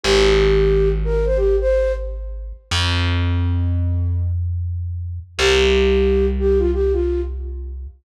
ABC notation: X:1
M:4/4
L:1/16
Q:"Swing 16ths" 1/4=90
K:Cm
V:1 name="Flute"
G6 B c G c2 z5 | z16 | G6 G F G F2 z5 |]
V:2 name="Electric Bass (finger)" clef=bass
A,,,16 | F,,16 | C,,16 |]